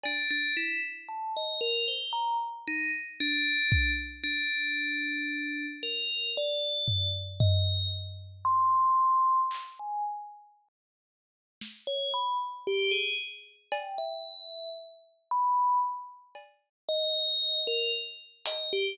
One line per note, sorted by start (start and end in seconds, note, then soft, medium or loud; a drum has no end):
0.04 0.29 D4 medium
0.04 cowbell medium
0.30 0.54 D4 medium
0.57 0.80 E4 medium
1.09 1.32 A5 medium
1.37 1.60 D#5 medium
1.61 1.85 A#4 medium
1.88 2.12 C5 medium
2.13 2.36 A#5 loud
2.68 2.91 D#4 medium
3.20 3.91 D4 medium
3.72 kick loud
4.23 5.66 D4 medium
5.83 6.30 A#4 medium
6.37 7.08 D5 medium
6.88 floor tom medium
7.40 7.88 D#5 medium
7.40 floor tom loud
8.45 9.40 C6 loud
9.51 clap medium
9.79 10.03 G#5 loud
11.61 snare medium
11.87 12.11 C#5 medium
12.14 12.38 B5 medium
12.67 12.91 G4 loud
12.91 13.15 G#4 medium
13.72 13.96 G5 loud
13.72 cowbell loud
13.98 14.69 E5 medium
15.31 15.79 B5 loud
16.35 cowbell medium
16.89 17.60 D#5 loud
17.67 17.91 A#4 medium
18.46 18.71 D#5 medium
18.46 closed hi-hat loud
18.73 18.96 G4 loud